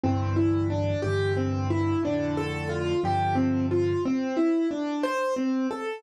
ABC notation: X:1
M:6/8
L:1/8
Q:3/8=60
K:Dm
V:1 name="Acoustic Grand Piano"
C E D G C E | D A F G C F | C E D c C A |]
V:2 name="Acoustic Grand Piano" clef=bass
[C,,G,,D,E,]3 [C,,G,,D,E,]3 | [F,,A,,D,]3 [G,,C,D,F,]3 | z6 |]